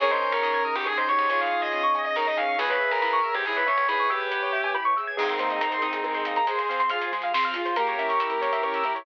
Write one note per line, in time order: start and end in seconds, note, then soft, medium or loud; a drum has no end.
0.00 0.19 G#1 medium
0.00 2.56 C#4 medium
0.00 0.86 C#4 medium
0.00 2.56 D#4 medium
0.00 2.56 G#4 medium
0.00 0.11 G#4 medium
0.00 0.63 A#4 medium
0.00 0.10 C#5 medium
0.00 0.63 C#5 medium
0.00 closed hi-hat loud
0.11 0.29 C5 medium
0.11 0.20 D#5 medium
0.21 0.64 D#4 medium
0.21 0.31 G#5 medium
0.21 closed hi-hat medium
0.32 0.42 G#2 medium
0.32 0.71 A#4 medium
0.32 0.42 C#6 medium
0.43 0.63 G#2 medium
0.43 1.30 G#4 soft
0.43 0.52 D#6 medium
0.43 closed hi-hat medium
0.54 0.64 G#6 medium
0.63 1.07 D#4 medium
0.63 0.75 D#6 medium
0.63 closed hi-hat medium
0.76 0.95 G#1 medium
0.76 0.86 G4 medium
0.76 0.85 C#6 medium
0.86 1.72 C#4 medium
0.86 1.06 G#4 medium
0.86 0.97 G#4 medium
0.86 0.96 G#5 medium
0.86 kick medium
0.86 cross-stick loud
0.97 1.08 C5 medium
0.97 1.07 D#5 medium
1.08 1.50 D#4 medium
1.08 1.28 G4 medium
1.08 1.17 C#5 medium
1.08 1.28 C#5 medium
1.08 closed hi-hat medium
1.19 1.28 G#2 medium
1.19 1.29 D#5 medium
1.29 1.49 G#1 medium
1.29 1.82 F4 medium
1.29 1.82 G#4 medium
1.29 2.15 G#4 medium
1.29 1.40 C#5 medium
1.29 1.39 G#5 medium
1.29 closed hi-hat loud
1.41 1.60 F5 medium
1.41 1.50 C#6 medium
1.51 1.94 D#4 soft
1.51 1.61 D#6 medium
1.51 closed hi-hat medium
1.62 2.01 D#5 medium
1.62 1.71 G#6 medium
1.72 2.55 C#4 medium
1.72 1.82 D#6 medium
1.72 closed hi-hat medium
1.83 1.93 C#6 medium
1.95 2.37 D#4 medium
1.95 2.05 G#5 medium
1.95 closed hi-hat medium
2.05 2.15 D#5 medium
2.15 2.36 D#4 medium
2.15 2.57 G#4 medium
2.15 2.26 A#4 medium
2.15 2.26 C#5 medium
2.15 kick medium
2.15 snare loud
2.26 2.36 D#5 medium
2.26 2.37 D#5 medium
2.37 2.56 C#4 medium
2.37 2.58 D#4 medium
2.37 2.55 F5 medium
2.37 2.47 G#5 medium
2.37 closed hi-hat medium
2.48 2.58 C#6 medium
2.59 2.78 C#2 medium
2.59 2.78 B3 medium
2.59 2.69 G#4 medium
2.59 3.19 G#4 medium
2.59 2.68 B4 medium
2.59 3.19 B4 medium
2.59 5.17 B4 medium
2.59 5.17 C#5 medium
2.59 5.17 E5 medium
2.59 5.17 G#5 medium
2.59 closed hi-hat loud
2.70 2.88 B4 medium
2.70 2.80 C#5 medium
2.80 2.99 C#4 medium
2.80 2.90 E5 medium
2.80 closed hi-hat medium
2.91 3.01 C#2 medium
2.91 3.31 A#4 medium
2.91 3.02 G#5 medium
3.02 3.22 C#2 medium
3.02 3.22 E4 medium
3.02 3.12 B5 medium
3.02 closed hi-hat medium
3.13 3.23 C#6 medium
3.23 3.43 G#4 medium
3.23 3.33 E6 medium
3.23 closed hi-hat medium
3.35 3.54 G#2 medium
3.35 3.45 G4 medium
3.35 3.45 G#6 medium
3.45 3.64 B3 medium
3.45 3.64 E4 medium
3.45 3.56 G#4 medium
3.45 3.55 B4 medium
3.45 kick medium
3.45 snare medium
3.56 3.67 B4 medium
3.56 3.66 C#5 medium
3.66 3.86 C#4 soft
3.66 3.86 C#4 medium
3.66 3.86 C#5 medium
3.66 3.76 E5 medium
3.66 closed hi-hat medium
3.77 3.87 C#2 medium
3.77 3.87 G#5 medium
3.88 4.08 G#2 medium
3.88 4.08 E4 medium
3.88 4.08 G#4 medium
3.88 4.09 B4 medium
3.88 3.98 B5 medium
3.88 closed hi-hat loud
3.99 4.09 C#6 medium
4.10 4.68 G4 medium
4.10 4.29 G#4 medium
4.10 4.49 B4 medium
4.10 4.19 E6 medium
4.10 closed hi-hat medium
4.20 4.30 G#6 medium
4.31 4.51 B3 medium
4.31 4.41 B4 medium
4.31 closed hi-hat loud
4.42 4.52 C#5 medium
4.53 4.73 C#4 medium
4.53 4.62 E5 medium
4.53 closed hi-hat medium
4.64 4.74 G#5 medium
4.74 4.94 E4 medium
4.74 4.84 B5 medium
4.74 kick medium
4.74 cross-stick loud
4.85 4.95 C#6 medium
4.97 5.16 G#4 soft
4.97 5.06 E6 medium
4.97 closed hi-hat medium
5.07 5.17 G#6 medium
5.17 5.37 G#3 loud
5.17 6.38 C4 medium
5.17 6.38 D#4 medium
5.17 5.27 G#4 medium
5.17 5.81 G#4 medium
5.17 5.81 A#4 medium
5.17 5.82 C5 medium
5.17 5.81 D#5 medium
5.17 crash loud
5.29 5.38 A#4 medium
5.29 closed hi-hat medium
5.39 5.59 A#3 medium
5.39 5.49 C5 medium
5.39 closed hi-hat loud
5.50 5.60 D#5 medium
5.50 closed hi-hat medium
5.61 5.80 C4 medium
5.61 5.71 A#5 medium
5.61 closed hi-hat loud
5.72 5.81 C6 medium
5.72 closed hi-hat medium
5.82 6.02 D#4 medium
5.82 6.46 G#4 medium
5.82 6.46 A#4 medium
5.82 6.46 D#5 medium
5.82 6.46 G#5 medium
5.82 5.92 D#6 medium
5.82 closed hi-hat loud
5.93 6.03 G#4 medium
5.93 closed hi-hat loud
6.04 6.24 G#3 loud
6.04 6.14 A#4 medium
6.04 kick loud
6.04 cross-stick loud
6.14 6.24 C5 medium
6.14 closed hi-hat medium
6.25 6.45 A#3 medium
6.25 6.35 D#5 medium
6.25 closed hi-hat loud
6.36 6.46 A#5 medium
6.36 closed hi-hat medium
6.46 6.66 G#3 loud
6.46 6.81 G#4 medium
6.46 7.12 G#4 medium
6.46 6.58 G#4 medium
6.46 6.81 C5 medium
6.46 7.12 C5 medium
6.46 7.12 F5 medium
6.46 closed hi-hat loud
6.58 6.68 C5 medium
6.58 closed hi-hat medium
6.69 6.89 C4 medium
6.69 6.79 F5 medium
6.69 closed hi-hat medium
6.80 6.89 C6 medium
6.80 closed hi-hat medium
6.89 7.11 F4 loud
6.89 7.29 G#4 medium
6.89 7.00 F6 medium
6.89 closed hi-hat loud
7.01 7.11 G#4 medium
7.01 closed hi-hat medium
7.12 7.32 G#3 medium
7.12 7.77 F4 medium
7.12 7.77 G#4 loud
7.12 7.22 C5 medium
7.12 7.77 F5 medium
7.12 closed hi-hat medium
7.22 7.33 F5 medium
7.22 closed hi-hat medium
7.34 7.53 C4 loud
7.34 7.44 C6 medium
7.34 kick loud
7.34 snare loud
7.43 7.54 F6 medium
7.43 closed hi-hat medium
7.54 7.75 F4 medium
7.54 7.65 G#4 medium
7.54 closed hi-hat loud
7.65 7.75 C5 medium
7.65 closed hi-hat medium
7.76 7.96 A#3 loud
7.76 8.42 A#3 medium
7.76 8.42 C#4 medium
7.76 8.42 E4 medium
7.76 8.99 G4 medium
7.76 7.86 A#4 loud
7.76 8.99 A#4 medium
7.76 closed hi-hat loud
7.87 7.98 C#5 medium
7.87 closed hi-hat medium
7.99 8.18 C#4 medium
7.99 8.08 E5 medium
7.99 closed hi-hat medium
8.09 8.19 C#6 medium
8.09 closed hi-hat medium
8.19 8.39 E4 medium
8.19 8.30 E6 medium
8.19 closed hi-hat loud
8.30 8.41 A#4 medium
8.30 closed hi-hat medium
8.41 9.05 E3 medium
8.41 8.62 A#3 medium
8.41 9.05 A#3 medium
8.41 9.05 E4 medium
8.41 8.51 C#5 medium
8.41 closed hi-hat loud
8.53 8.62 E5 medium
8.53 closed hi-hat medium
8.63 8.83 C#4 medium
8.63 8.73 C#6 medium
8.63 kick loud
8.63 cross-stick loud
8.74 8.84 E6 medium
8.74 closed hi-hat medium
8.83 9.04 E4 medium
8.83 8.94 A#4 medium
8.83 closed hi-hat medium
8.95 9.05 C#5 medium
8.95 closed hi-hat medium